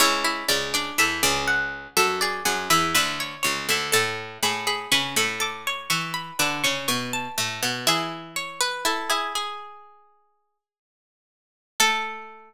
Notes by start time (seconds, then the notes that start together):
0.00 C#2 C#3 E4 C#5
0.24 E4
0.48 C#2 C#3 C#4 D5
0.74 D4 D5
0.98 E2 E3 A4 E5
1.23 C#2 C#3 D5
1.48 F#5
1.97 F#2 F#3 A4 E5
2.21 G#4 D5
2.45 F#2 F#3 G#4 F#5
2.70 E2 E3 B4 E5
2.94 D2 D3 B4 E5
3.20 C#5
3.43 C#2 C#3 C#5
3.69 D2 D3 E5
3.92 A2 A3 A4 A5
4.43 A2 A3 G#4 B5
4.67 G#4 B5
4.92 C#3 C#4 B4 C#6
5.16 A2 A3 A4 B5
5.40 A4 D6
5.67 C#5
5.90 E3 E4 C#6
6.14 B5
6.39 D3 D4 B4 D6
6.64 C#3 C#4 C#6
6.88 B2 B3 C#6
7.13 A5
7.38 A2 A3
7.63 B2 B3
7.87 E3 E4 G#4 E5
8.36 C#5
8.60 B4
8.85 E4 A4
9.10 E4 G#4
9.35 G#4
11.80 A3 A4